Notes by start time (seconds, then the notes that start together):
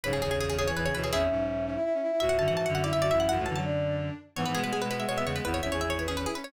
0.03 B1 G#2 C#3 B4 C#5
0.13 B1 G#2 G#4
0.22 G#1 E2 C#3 G#4
0.31 G#1 E2 G#4
0.39 G#1 E2 G#4 C#5
0.49 G#1 E2 G#4
0.57 C#3 G#4 C#5
0.67 E3 G#4 C#5
0.75 G#1 E2 E3 G#4 B4
0.85 C#3 G#4 C#5
0.94 D2 B2 E3 B4 C#5
1.03 E3 G#4 C#5
1.11 G#1 E2 C#4 E4 G#4 E5
1.30 B1 G#2 C#4
1.48 E5
1.65 C#4 E5
1.74 E4 E5
1.84 E4 E5
1.93 C#4 E5
2.02 E4 E5
2.11 E4 E5
2.20 C#2 A2 F#4 E5
2.29 C#2 A2 F#5
2.38 F#2 D3 F#4 A5
2.48 G#2 E3 F#5
2.56 G#2 E3 E5 A5
2.66 F#2 D3 F#5
2.74 F#4 E5 F#5
2.83 E4 D5 E5
2.93 F#2 D3 E4 E5
3.02 F#4 D5 E5
3.11 A1 F#2 E4 E5
3.20 E4 E5 F#5
3.29 A1 F#2 E4 F#4 F#5
3.38 C#2 A2 A3
3.46 F#2 D3 E3 A5
3.56 F#3 A5
3.64 D4
4.36 G#2 E3 B3 C#5
4.45 G#2 E3 B4
4.54 B2 G#3 B3 G#4
4.64 B2 G#3 B4
4.73 B2 G#3 B3 G#4
4.82 B2 G#3 B4
4.90 B3 B4
5.00 G#3 B3 E5
5.08 B2 G#3 B3 C#5
5.18 B3 E5
5.24 E2 C#3 G#3 B3 C#5
5.36 G#3 B3 B4
5.44 G#1 E2 B3 E4 B4
5.54 C#5
5.61 G#1 E2 C#4 E4 E5
5.71 G#1 E2 G#4 C#5
5.81 G#4 E5
5.90 C#5
5.98 E4 B4 C#5
6.08 C#4 G#4
6.17 C#4 B4
6.26 E4 G#4
6.35 C#4 B4
6.44 C#4 C#5